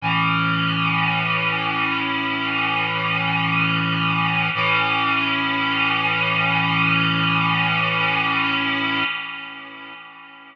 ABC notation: X:1
M:4/4
L:1/8
Q:1/4=53
K:A
V:1 name="Clarinet"
[A,,E,C]8 | [A,,E,C]8 |]